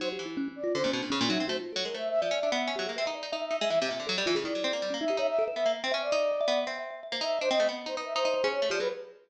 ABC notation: X:1
M:2/4
L:1/16
Q:1/4=162
K:none
V:1 name="Flute"
c z5 d2 | c2 z4 e2 | c z3 (3_B2 e2 e2 | e2 e e5 |
e z3 (3e2 e2 e2 | e z7 | d6 e2 | e e2 e e2 z c |
z d7 | z6 e2 | c _e2 z2 c B =e | c4 _d2 =d B |]
V:2 name="Harpsichord"
_G,2 E,6 | D, _B,, =B,, _B,, _D, B,, _G, C | A, z2 _G, _A, =A,3 | F, _D =D B,2 _D _G, _B, |
C _E2 E E2 E _A, | E, C, _B,, D, _G, =G, E, _D, | _E, _G, C _B, (3=G,2 B,2 _E2 | _E4 B, _B,2 C |
_D2 _E4 B,2 | C4 z _B, _E2 | D C A, B,2 _E E2 | _E E2 _D2 A, F, _G, |]
V:3 name="Kalimba"
(3_E2 G2 =E2 (3_D2 D2 F2 | (3_D2 D2 =D2 _D2 _E2 | (3_G2 F2 A2 _B c3 | d4 z2 G _A |
B e d2 e e e e | e2 e2 A z F _A | E2 z3 _D _E G | _d z A B e e z2 |
(3e2 e2 e2 d e e2 | (3e2 e2 e2 e c e z | _e8 | e e c _A z2 G A |]